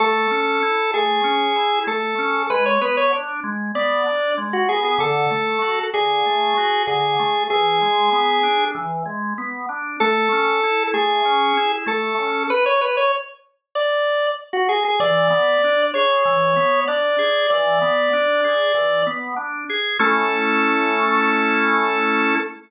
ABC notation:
X:1
M:4/4
L:1/16
Q:1/4=96
K:A
V:1 name="Drawbar Organ"
A6 G6 A4 | B c B c z4 d4 z F G G | A6 G6 G4 | G8 z8 |
A6 G6 A4 | B c B c z4 d4 z F G G | d6 c6 d4 | d10 z6 |
A16 |]
V:2 name="Drawbar Organ"
A,2 C2 E2 A,2 C2 E2 A,2 C2 | G,2 B,2 D2 G,2 B,2 D2 G,2 B,2 | D,2 A,2 F2 D,2 A,2 F2 D,2 A,2 | E,2 G,2 B,2 D2 E,2 G,2 B,2 D2 |
A,2 C2 E2 A,2 C2 E2 A,2 C2 | z16 | E,2 B,2 D2 G2 E,2 B,2 D2 G2 | E,2 B,2 D2 G2 E,2 B,2 D2 G2 |
[A,CE]16 |]